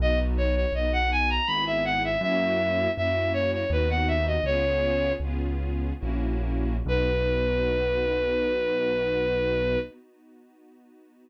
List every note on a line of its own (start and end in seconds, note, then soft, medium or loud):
0.00 0.66 B1 loud
0.00 0.65 B3 loud
0.00 0.65 D#4 loud
0.00 0.65 F#4 loud
0.00 0.19 D#5 loud
0.38 0.55 C#5 medium
0.55 0.73 C#5 medium
0.72 1.39 B1 medium
0.72 1.41 B3 loud
0.72 1.41 D#4 loud
0.72 1.41 F#4 medium
0.72 0.92 D#5 medium
0.93 1.10 F#5 medium
1.12 1.29 G#5 medium
1.30 1.47 A#5 medium
1.47 2.16 G#1 loud
1.47 2.15 B3 loud
1.47 2.15 E4 loud
1.47 2.15 G#4 loud
1.47 1.64 B5 medium
1.67 1.84 E5 medium
1.85 2.03 F#5 medium
2.04 2.21 E5 medium
2.21 2.88 F#2 loud
2.21 2.89 A#3 loud
2.21 2.89 C#4 loud
2.21 2.89 E4 loud
2.21 2.89 F#4 loud
2.21 2.91 E5 loud
2.97 3.64 F#2 medium
2.97 3.64 A#3 loud
2.97 3.64 C#4 loud
2.97 3.64 E4 loud
2.97 3.64 F#4 medium
2.97 3.32 E5 medium
3.33 3.51 C#5 medium
3.53 3.71 C#5 medium
3.70 4.38 D#2 loud
3.70 4.37 B3 loud
3.70 4.37 D#4 loud
3.70 4.37 F#4 loud
3.70 3.90 B4 medium
3.90 4.08 F#5 medium
4.08 4.25 E5 medium
4.27 4.44 D#5 medium
4.44 5.12 C#2 medium
4.44 5.13 B3 loud
4.44 5.13 C#4 loud
4.44 5.13 F4 loud
4.44 5.13 G#4 loud
4.44 5.12 C#5 loud
5.20 5.92 C#2 medium
5.20 5.93 B3 loud
5.20 5.93 C#4 loud
5.20 5.93 F4 loud
5.20 5.93 G#4 medium
5.99 6.81 A#1 medium
5.99 6.76 A#3 loud
5.99 6.76 C#4 loud
5.99 6.76 E4 loud
5.99 6.76 F#4 loud
6.86 9.77 B1 loud
6.86 9.79 B3 loud
6.86 9.79 D#4 loud
6.86 9.79 F#4 loud
6.86 9.79 B4 loud